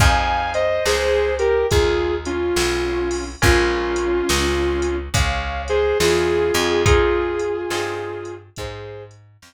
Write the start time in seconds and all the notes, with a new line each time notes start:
0.00 F2 C4 D#4 F4 G#4 F5 G#5, kick, closed hi-hat
0.54 C5 D#5, closed hi-hat
0.86 C#2 G#4 C5, snare
1.39 G4 A#4, closed hi-hat
1.71 D#2 F4 G#4, kick, closed hi-hat
2.26 C#4 F4, closed hi-hat
2.56 B1, snare
3.11 open hi-hat
3.42 A#1 A#3 C#4 F4 G#4, kick, closed hi-hat
3.96 closed hi-hat
4.29 C#2, snare
4.82 closed hi-hat
5.14 C#2 C#5 F5, kick, closed hi-hat
5.68 G#4 C5, closed hi-hat
6.00 E2 F4 G#4, snare
6.54 F2, closed hi-hat
6.86 C4 D#4 F4 G#4, kick, closed hi-hat
7.39 closed hi-hat
7.70 G2 C4 D#4 F4 G#4, snare
8.25 closed hi-hat
8.56 G#2 G#4 C5, kick, closed hi-hat
9.11 closed hi-hat
9.42 F2, snare